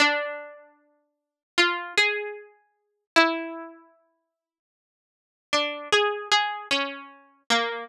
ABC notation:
X:1
M:2/4
L:1/8
Q:1/4=76
K:none
V:1 name="Harpsichord"
D4 | F ^G3 | E4 | z2 D ^G |
^G ^C2 ^A, |]